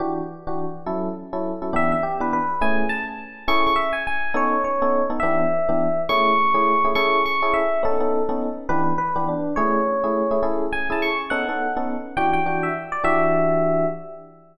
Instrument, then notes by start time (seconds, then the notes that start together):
electric piano 1
0.00 E3 D4 F#4 G4
0.47 E3 D4 F#4 G4
0.86 F#3 C#4 E4 A4
1.33 F#3 C#4 E4 A4
1.62 F#3 C#4 E4 A4
1.73 E3 B3 D4 G4 E5
1.92 E5
2.03 G4
2.20 E3 B3 D4 G4 B4
2.33 B4
2.61 A3 C#4 E4 G#4 G#5
2.89 A5
3.48 C#4 E4 G#4 A4 C#6
3.67 C#6
3.76 E5
3.93 G#5
4.07 G#5
4.34 B3 C#4 D#4 A4 C#5
4.64 C#5
4.82 B3 C#4 D#4 A4
5.10 B3 C#4 D#4 A4
5.20 E3 B3 D4 G4 E5
5.69 E3 B3 D4 G4
6.09 A3 C#4 E4 G#4 C#6
6.54 A3 C#4 E4 G#4
6.84 A3 C#4 E4 G#4
6.95 C#4 E4 G#4 A4 C#6
7.26 C#6
7.42 C#4 E4 G#4 A4
7.54 E5
7.83 B3 C#4 D#4 A4
8.00 B3 C#4 D#4 A4
8.29 B3 C#4 D#4 A4
8.69 E3 B3 D4 G4 B4
8.98 B4
9.16 E3 B3 D4 G4
9.28 D4
9.56 A3 C#4 E4 G#4 C#5
10.04 A3 C#4 E4 G#4
10.31 A3 C#4 E4 G#4
10.43 C#4 E4 G#4 A4
10.73 G#5
10.90 C#4 E4 G#4 A4 A5
11.02 C#6
11.30 B3 C#4 D#4 A4 F#5
11.49 B3 C#4 D#4 A4
11.77 B3 C#4 D#4 A4
12.17 E3 D4 F#4 G4 G5
12.33 G5
12.46 E3 D4 F#4 G4
12.63 E5
12.92 D5
13.04 E3 D4 F#4 G4 E5